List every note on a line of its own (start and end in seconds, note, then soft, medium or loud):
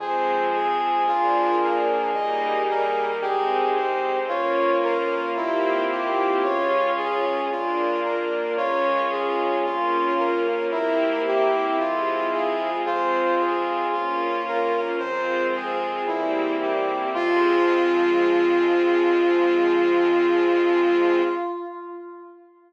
0.00 0.98 F2 medium
0.00 1.06 F3 medium
0.00 1.06 G#3 medium
0.00 1.06 C4 medium
0.00 3.05 G#4 medium
0.00 0.49 C5 medium
0.54 1.04 G#4 medium
1.06 2.06 A#1 medium
1.06 2.13 F3 medium
1.06 2.13 A#3 medium
1.06 2.13 D4 medium
1.06 1.56 F4 medium
1.61 2.11 A#4 medium
2.13 3.13 D#2 medium
2.13 3.21 G3 medium
2.13 3.21 A#3 medium
2.13 3.21 D#4 medium
2.13 2.63 D#5 medium
2.69 3.18 A#4 medium
3.21 4.20 C2 medium
3.21 4.28 G#3 medium
3.21 4.28 C4 medium
3.21 4.28 D#4 medium
3.21 4.19 G4 medium
3.21 3.70 G#4 medium
3.75 4.24 C5 medium
4.28 5.27 C#2 medium
4.28 5.35 A#3 medium
4.28 5.35 C#4 medium
4.28 7.25 F4 medium
4.28 5.35 F4 medium
4.28 4.78 C#5 medium
4.83 5.32 A#4 medium
5.35 6.34 C2 loud
5.35 6.42 A#3 medium
5.35 6.42 C4 medium
5.35 5.85 E4 medium
5.35 6.42 E4 medium
5.35 6.42 G4 medium
5.90 6.39 G4 medium
6.42 7.42 C#2 medium
6.42 7.48 G#3 medium
6.42 7.48 C#4 medium
6.42 7.48 F4 medium
6.42 6.92 C#5 medium
6.96 7.45 G#4 medium
7.50 8.49 A#1 medium
7.50 8.57 A#3 medium
7.50 8.57 D4 medium
7.50 8.00 F4 medium
7.50 8.57 F4 medium
8.02 8.52 A#4 medium
8.56 9.56 C#2 medium
8.56 9.64 G#3 medium
8.56 9.64 C#4 medium
8.56 10.47 F4 medium
8.56 9.64 F4 medium
8.56 9.05 C#5 medium
9.10 9.59 G#4 medium
9.64 10.63 A#1 loud
9.64 10.71 A#3 medium
9.64 10.71 C#4 medium
9.64 10.14 F4 medium
9.64 10.71 F4 medium
10.18 10.67 A#4 medium
10.71 11.70 E2 medium
10.71 11.77 A#3 medium
10.71 11.77 C4 medium
10.71 12.70 E4 medium
10.71 11.77 E4 loud
10.71 11.77 G4 medium
10.71 11.22 A#4 medium
11.26 11.75 G4 medium
11.78 12.77 F2 medium
11.78 12.84 G#3 medium
11.78 12.84 C4 medium
11.78 12.84 F4 medium
11.78 12.28 F4 medium
12.32 12.81 G#4 medium
12.85 13.84 F2 medium
12.85 13.91 G#3 medium
12.85 13.91 C4 medium
12.85 13.91 F4 medium
12.85 14.81 F4 medium
12.85 13.35 C5 medium
13.38 13.88 G#4 medium
13.93 14.92 A#1 medium
13.93 15.00 A#3 medium
13.93 15.00 C#4 medium
13.93 14.42 F4 medium
13.93 15.00 F4 medium
14.46 14.96 A#4 medium
14.98 15.99 F2 medium
14.98 16.06 G#3 medium
14.98 16.06 C4 medium
14.98 16.06 F4 medium
14.98 15.47 C5 medium
15.54 16.03 G#4 medium
16.07 17.06 E2 loud
16.07 17.13 G3 medium
16.07 17.13 A#3 medium
16.07 17.13 C4 medium
16.07 16.56 E4 medium
16.07 17.13 E4 medium
16.60 17.09 G4 medium
17.14 21.22 F2 loud
17.14 21.22 F3 loud
17.14 21.22 G#3 loud
17.14 21.22 C4 loud
17.14 21.21 F4 loud
17.14 21.23 F4 loud